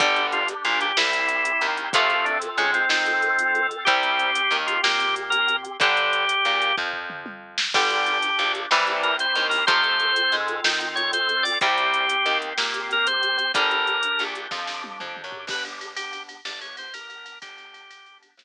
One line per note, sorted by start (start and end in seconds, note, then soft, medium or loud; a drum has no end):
0.00 0.54 G1 medium
0.00 0.43 D3 loud
0.00 0.43 G3 medium
0.00 0.95 D4 medium
0.00 0.27 G4 medium
0.00 0.95 G4 medium
0.00 kick medium
0.00 closed hi-hat medium
0.16 closed hi-hat medium
0.32 0.48 F4 medium
0.32 closed hi-hat medium
0.48 closed hi-hat medium
0.65 0.92 A#1 medium
0.65 0.92 A#2 medium
0.65 0.79 F4 medium
0.65 closed hi-hat medium
0.81 0.97 G4 medium
0.81 closed hi-hat medium
0.97 1.52 C2 medium
0.97 1.92 C4 medium
0.97 1.92 E4 medium
0.97 1.67 E4 medium
0.97 1.92 G4 medium
0.97 snare loud
1.13 closed hi-hat medium
1.29 closed hi-hat medium
1.45 closed hi-hat medium
1.61 1.89 D#2 medium
1.61 1.89 D#3 medium
1.61 closed hi-hat medium
1.77 closed hi-hat medium
1.93 2.49 F2 medium
1.93 2.37 C3 medium
1.93 2.37 F3 loud
1.93 2.37 A3 loud
1.93 3.84 C4 medium
1.93 3.84 F4 medium
1.93 2.26 F4 medium
1.93 3.84 A4 medium
1.93 kick loud
1.93 closed hi-hat loud
2.10 closed hi-hat medium
2.25 2.38 D4 medium
2.25 closed hi-hat medium
2.42 closed hi-hat medium
2.58 2.85 G#2 medium
2.58 2.85 G#3 medium
2.58 2.71 C#4 medium
2.58 closed hi-hat medium
2.74 2.89 C4 medium
2.74 closed hi-hat medium
2.89 3.72 D#3 medium
2.89 3.67 C4 medium
2.89 3.73 D#4 medium
2.89 snare medium
3.06 closed hi-hat medium
3.22 closed hi-hat medium
3.39 closed hi-hat medium
3.55 closed hi-hat medium
3.71 closed hi-hat medium
3.85 4.41 C2 medium
3.85 4.31 C3 loud
3.85 4.31 G3 loud
3.85 5.77 C4 medium
3.85 4.57 G4 medium
3.85 5.77 G4 medium
3.85 kick medium
3.85 closed hi-hat medium
4.03 closed hi-hat medium
4.19 closed hi-hat medium
4.35 closed hi-hat loud
4.51 4.78 D#2 medium
4.51 4.79 D#3 medium
4.51 closed hi-hat medium
4.67 4.81 F4 medium
4.67 closed hi-hat medium
4.83 5.67 A#2 medium
4.83 5.66 A#3 medium
4.83 5.15 G4 medium
4.83 snare medium
5.00 closed hi-hat medium
5.16 closed hi-hat medium
5.30 5.56 A#4 medium
5.30 closed hi-hat medium
5.48 closed hi-hat medium
5.65 closed hi-hat medium
5.80 6.35 G1 medium
5.80 6.25 D3 loud
5.80 6.25 G3 medium
5.80 6.76 G4 medium
5.80 kick medium
5.80 closed hi-hat medium
5.97 closed hi-hat medium
6.13 closed hi-hat medium
6.29 closed hi-hat medium
6.45 6.73 A#1 medium
6.45 6.73 A#2 medium
6.45 closed hi-hat medium
6.62 closed hi-hat medium
6.77 7.60 F2 medium
6.77 7.60 F3 medium
6.77 kick medium
6.77 floor tom medium
6.93 floor tom medium
7.10 mid tom medium
7.26 high tom medium
7.58 snare medium
7.74 8.30 G1 medium
7.74 8.18 D3 medium
7.74 8.18 G3 loud
7.74 8.69 D4 medium
7.74 8.69 G4 medium
7.74 8.52 G4 medium
7.74 kick medium
7.74 crash medium
7.90 closed hi-hat medium
8.06 closed hi-hat medium
8.22 closed hi-hat medium
8.39 8.66 A#1 medium
8.39 8.66 A#2 medium
8.39 closed hi-hat medium
8.55 closed hi-hat medium
8.71 9.26 C2 medium
8.71 9.14 C3 medium
8.71 9.14 E3 loud
8.71 9.14 G3 loud
8.71 9.66 C4 medium
8.71 9.66 E4 medium
8.71 9.66 G4 medium
8.71 snare medium
8.87 closed hi-hat medium
9.03 9.16 A#4 medium
9.03 closed hi-hat medium
9.19 9.47 C5 medium
9.19 closed hi-hat medium
9.35 9.64 D#2 medium
9.35 9.63 D#3 medium
9.35 closed hi-hat medium
9.50 9.65 A#4 medium
9.50 open hi-hat medium
9.67 10.23 F2 medium
9.67 10.11 C3 loud
9.67 10.11 F3 medium
9.67 10.11 A3 medium
9.67 11.57 C4 medium
9.67 11.57 F4 medium
9.67 11.57 A4 medium
9.67 10.36 C5 loud
9.67 kick medium
9.67 closed hi-hat medium
9.84 closed hi-hat soft
10.00 closed hi-hat medium
10.16 closed hi-hat medium
10.32 10.61 G#2 medium
10.32 10.60 G#3 medium
10.32 closed hi-hat medium
10.48 closed hi-hat medium
10.64 11.47 D#3 medium
10.64 11.47 D#4 medium
10.64 snare loud
10.81 closed hi-hat medium
10.96 11.11 C#5 medium
10.96 closed hi-hat medium
11.13 11.44 C5 medium
11.13 closed hi-hat medium
11.29 closed hi-hat medium
11.43 11.58 D5 medium
11.43 open hi-hat medium
11.61 12.17 C2 medium
11.61 12.05 C3 medium
11.61 12.05 G3 medium
11.61 13.51 C4 medium
11.61 13.51 G4 medium
11.61 12.38 G4 medium
11.61 kick medium
11.61 closed hi-hat medium
11.78 closed hi-hat medium
11.94 closed hi-hat medium
12.09 closed hi-hat medium
12.26 12.53 D#2 medium
12.26 12.53 D#3 medium
12.26 closed hi-hat medium
12.42 closed hi-hat medium
12.58 13.40 A#2 medium
12.58 13.40 A#3 medium
12.58 snare medium
12.74 closed hi-hat medium
12.91 13.07 A#4 medium
12.91 closed hi-hat medium
13.07 13.37 C5 medium
13.07 closed hi-hat medium
13.23 closed hi-hat medium
13.37 13.52 C5 medium
13.37 closed hi-hat medium
13.54 14.09 G1 medium
13.54 13.98 D3 loud
13.54 13.98 G3 medium
13.54 15.45 D4 medium
13.54 15.45 G4 medium
13.54 14.23 A#4 medium
13.54 kick medium
13.54 closed hi-hat medium
13.71 closed hi-hat medium
13.87 closed hi-hat medium
14.03 closed hi-hat medium
14.19 14.48 A#1 medium
14.19 14.47 A#2 medium
14.19 closed hi-hat medium
14.35 closed hi-hat medium
14.51 14.97 F2 medium
14.51 14.98 F3 medium
14.51 kick medium
14.51 snare medium
14.67 snare medium
14.84 high tom medium
15.00 15.23 F2 medium
15.00 15.22 F3 medium
15.00 mid tom medium
15.17 mid tom medium
15.24 15.46 F#2 medium
15.24 15.46 F#3 medium
15.32 floor tom medium
15.47 16.36 G1 medium
15.47 15.92 B3 medium
15.47 15.92 D4 medium
15.47 15.92 G4 medium
15.47 15.64 B4 medium
15.47 kick medium
15.47 crash medium
15.65 ride medium
15.81 ride medium
15.96 16.40 B3 medium
15.96 16.40 D4 medium
15.96 16.23 G4 medium
15.96 16.40 G4 medium
15.96 ride medium
16.13 ride medium
16.29 ride medium
16.45 17.34 G1 medium
16.45 16.88 B3 medium
16.45 16.88 D4 medium
16.45 16.88 G4 medium
16.45 16.60 D5 medium
16.45 snare medium
16.61 16.76 C#5 medium
16.61 ride medium
16.77 16.94 C5 medium
16.77 ride medium
16.94 17.38 B3 medium
16.94 17.38 D4 medium
16.94 17.38 G4 medium
16.94 17.39 A#4 medium
16.94 ride medium
17.10 ride medium
17.26 ride medium
17.41 18.31 G1 medium
17.41 17.85 B3 medium
17.41 17.85 D4 medium
17.41 17.85 G4 medium
17.41 18.18 G4 loud
17.41 kick medium
17.41 ride medium
17.58 ride medium
17.74 ride medium
17.90 18.34 B3 medium
17.90 18.34 D4 medium
17.90 18.34 G4 medium
17.90 ride medium
18.06 ride medium
18.23 ride medium
18.37 18.44 G1 medium
18.37 18.44 B3 medium
18.37 18.44 D4 medium
18.37 18.44 G4 medium
18.37 snare loud